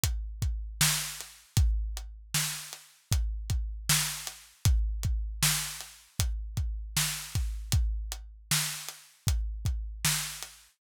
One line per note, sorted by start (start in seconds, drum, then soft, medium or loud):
0.03 kick medium
0.03 closed hi-hat loud
0.42 kick medium
0.42 closed hi-hat medium
0.81 snare loud
1.21 closed hi-hat medium
1.57 kick loud
1.57 closed hi-hat loud
1.97 closed hi-hat medium
2.34 snare loud
2.73 closed hi-hat medium
3.12 kick loud
3.12 closed hi-hat loud
3.50 kick medium
3.50 closed hi-hat medium
3.89 snare loud
4.27 closed hi-hat medium
4.65 kick loud
4.65 closed hi-hat loud
5.03 kick medium
5.03 closed hi-hat medium
5.42 snare loud
5.80 closed hi-hat medium
6.19 kick medium
6.19 closed hi-hat loud
6.57 kick medium
6.57 closed hi-hat medium
6.96 snare loud
7.35 kick medium
7.35 closed hi-hat medium
7.72 kick loud
7.72 closed hi-hat loud
8.12 closed hi-hat medium
8.51 snare loud
8.88 closed hi-hat medium
9.27 kick loud
9.27 closed hi-hat loud
9.65 kick medium
9.65 closed hi-hat medium
10.05 snare loud
10.42 closed hi-hat medium